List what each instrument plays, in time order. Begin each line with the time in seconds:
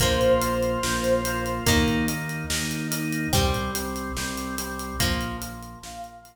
0.00 synth bass 1 A#1, acoustic guitar (steel) F3 A#3, drawbar organ A#3 F4, lead 2 (sawtooth) C5, kick, closed hi-hat
0.21 closed hi-hat
0.41 drawbar organ A#3 F4, closed hi-hat
0.63 closed hi-hat
0.83 synth bass 1 A#1, drawbar organ A#3 F4, snare
1.04 closed hi-hat
1.25 drawbar organ A#3 F4, closed hi-hat
1.46 closed hi-hat
1.66 synth bass 1 D#2, acoustic guitar (steel) D#3 A#3, drawbar organ A#3 D#4, kick, closed hi-hat
1.88 closed hi-hat
2.08 drawbar organ A#3 D#4, closed hi-hat
2.29 closed hi-hat
2.50 synth bass 1 D#2, drawbar organ A#3 D#4, snare
2.71 closed hi-hat
2.91 drawbar organ A#3 D#4, closed hi-hat
3.13 closed hi-hat
3.33 synth bass 1 C2, drawbar organ G3 C4, acoustic guitar (steel) G3 C4, kick, closed hi-hat
3.54 closed hi-hat
3.75 drawbar organ G3 C4, closed hi-hat
3.96 closed hi-hat
4.17 synth bass 1 C2, drawbar organ G3 C4, snare
4.38 closed hi-hat
4.58 drawbar organ G3 C4, closed hi-hat
4.79 closed hi-hat
4.99 synth bass 1 A#1, drawbar organ F3 A#3, acoustic guitar (steel) F3 A#3, kick, closed hi-hat
5.21 closed hi-hat
5.41 drawbar organ F3 A#3, closed hi-hat
5.63 closed hi-hat
5.82 synth bass 1 A#1, drawbar organ F3 A#3, lead 2 (sawtooth) F5, snare
6.04 closed hi-hat
6.25 drawbar organ F3 A#3, closed hi-hat